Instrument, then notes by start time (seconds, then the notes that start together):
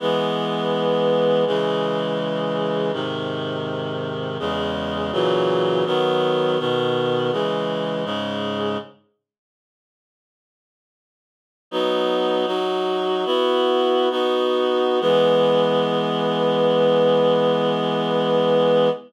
clarinet
0.00 E3 G#3 B3
1.46 C#3 E3 G#3
2.93 G#2 C3 D#3
4.39 E2 C#3 G#3
5.12 A#2 C#3 E3 F#3
5.86 D#3 F#3 B3
6.59 B2 D#3 B3
7.32 C#3 E3 G#3
8.05 G#2 C#3 G#3
11.71 F#3 B3 D#4
12.46 F#3 D#4 F#4
13.25 B3 E4 F#4
14.10 B3 D#4 F#4
15.00 E3 G#3 B3